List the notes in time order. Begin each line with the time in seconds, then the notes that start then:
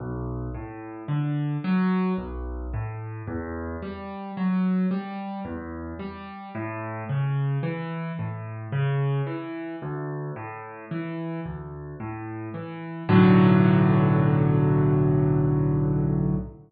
0.00 B1
0.55 A2
1.08 D3
1.64 F#3
2.18 B1
2.73 A2
3.27 E2
3.82 G3
4.37 F#3
4.91 G3
5.45 E2
5.99 G3
6.55 A2
7.09 C#3
7.63 E3
8.19 A2
8.72 C#3
9.27 E3
9.82 D2
10.36 A2
10.91 E3
11.46 D2
12.00 A2
12.54 E3
13.09 B1 A2 D3 F#3